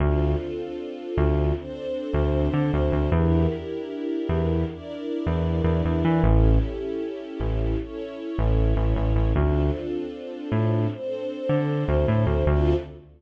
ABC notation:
X:1
M:4/4
L:1/16
Q:1/4=77
K:Dm
V:1 name="String Ensemble 1"
[CDFA]8 [CDAc]8 | [DEGB]8 [DEBd]8 | [^CEGA]8 [CEA^c]8 | [CDFA]8 [CDAc]8 |
[CDFA]4 z12 |]
V:2 name="Synth Bass 1" clef=bass
D,,6 D,,5 D,,2 D, D,, D,, | E,,6 E,,5 E,,2 E,, E,, E, | A,,,6 A,,,5 A,,,2 A,,, A,,, A,,, | D,,6 A,,5 D,2 D,, A,, D,, |
D,,4 z12 |]